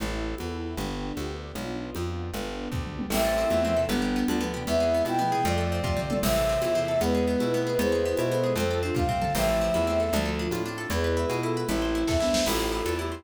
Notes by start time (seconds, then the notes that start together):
0.00 A1 C4 E4 A4, low conga
0.38 E2, high conga
0.77 G1 B3 D4 G4, low conga
1.17 D2, high conga
1.55 B1 B3 D4 F4, low conga
1.95 F2, high conga
2.34 G1 B3 D4 G4, low conga
2.72 D2, kick, floor tom
2.87 mid tom
2.99 high tom
3.10 A1 A3 C4 E4 E5, crash, low conga
3.25 A4
3.38 C4
3.50 E2 A3 C4 E4, high conga
3.63 F3 A3 C4
3.77 C3 E3 A4
3.89 G1 G3 B3 D4, low conga
4.02 G4
4.16 B3
4.28 D2 G3 B3 D4, high conga
4.41 F3 A3 B3
4.54 C3 E3 G4
4.67 E2 G#3 B3 C4 E4 E5, low conga
4.80 G#4
4.94 B3
5.05 B2 C4 E4 G5, high conga
5.19 F3 A3 B3
5.32 C3 E3 G#4
5.45 F2 F3 A3 C4 F4 D5, low conga
5.58 A4
5.72 C4
5.84 C3 F4, kick, floor tom
5.97 C4, mid tom
6.10 A4, high tom
6.23 A1 C3 E3 A3 C4 E4 E5, crash, low conga
6.36 A4
6.49 C4
6.62 E2 E4, high conga
6.75 C3 E3 C4
6.88 A4
7.01 E2 G#3 B3 E4 B4, low conga
7.15 G#4
7.27 B3
7.40 B2 E4, high conga
7.53 A3 B3 C4
7.67 G#4
7.79 E2 G#3 B3 E4 G#4 B4 C5, low conga
7.92 G#4
8.05 B3
8.17 B2 E4, high conga
8.31 B3 A4 C5
8.44 G#4
8.56 F2 A3 C4 F4 A4 C5, low conga
8.71 A4
8.83 C4 D4 F4
8.95 C3 F4 F5, kick, high tom
9.09 C4, floor tom
9.22 A4, mid tom
9.35 A1 F3 A3 C4 E4 E5, crash, low conga
9.49 A4
9.61 C4
9.74 E2 E4, high conga
9.87 A3 C4
10.00 A4
10.13 D2 F3 A3 D4 F4, low conga
10.26 A4
10.39 D4
10.51 A2 F4, high conga
10.65 A3 C4 D4
10.78 A4
10.90 E2 G#3 B3 E4 G#4 B4, low conga
11.04 B4
11.17 E4
11.29 B2 G#4, high conga
11.43 E4 F4 A4
11.57 B4
11.69 A1 A3 C4 E4, low conga
11.82 C5
11.95 E4
12.07 E2 A4 E5, kick, snare
12.20 B3 D4 E4, snare
12.34 C5, snare
12.46 A1 A3 C4 E4 F4 A4, crash, low conga
12.60 C5
12.72 E4
12.86 E2 A4, high conga
12.99 E4 G4
13.12 C5